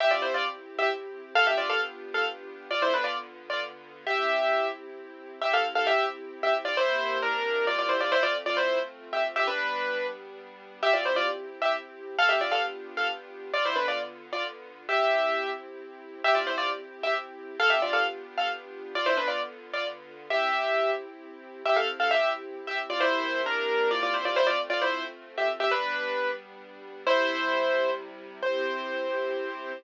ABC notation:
X:1
M:3/4
L:1/16
Q:1/4=133
K:C
V:1 name="Acoustic Grand Piano"
[Ge] [Fd] [Ec] [Fd] z3 [Ge] z4 | [Af] [Ge] [Fd] [Af] z3 [Af] z4 | [Fd] [Ec] [DB] [Fd] z3 [Fd] z4 | [Ge]6 z6 |
[Ge] [Af] z [Af] [Ge]2 z3 [Ge] z [Fd] | [Ec]4 [D_B]4 [Fd] [Fd] [Ec] [Fd] | [Ec] [Fd] z [Fd] [Ec]2 z3 [Ge] z [Ge] | [DB]6 z6 |
[Ge] [Fd] [Ec] [Fd] z3 [Ge] z4 | [Af] [Ge] [Fd] [Af] z3 [Af] z4 | [Fd] [Ec] [DB] [Fd] z3 [Fd] z4 | [Ge]6 z6 |
[Ge] [Fd] [Ec] [Fd] z3 [Ge] z4 | [Af] [Ge] [Fd] [Af] z3 [Af] z4 | [Fd] [Ec] [DB] [Fd] z3 [Fd] z4 | [Ge]6 z6 |
[Ge] [Af] z [Af] [Ge]2 z3 [Ge] z [Fd] | [Ec]4 [D_B]4 [Fd] [Fd] [Ec] [Fd] | [Ec] [Fd] z [Fd] [Ec]2 z3 [Ge] z [Ge] | [DB]6 z6 |
[Ec]8 z4 | c12 |]
V:2 name="String Ensemble 1"
[CEG]12 | [B,DFG]12 | [D,B,F]12 | [CEG]12 |
[CEG]12 | [C,_B,EG]12 | [A,CF]12 | [G,B,D]12 |
[CEG]12 | [B,DFG]12 | [D,B,F]12 | [CEG]12 |
[CEG]12 | [B,DFG]12 | [D,B,F]12 | [CEG]12 |
[CEG]12 | [C,_B,EG]12 | [A,CF]12 | [G,B,D]12 |
[C,G,E]12 | [CEG]12 |]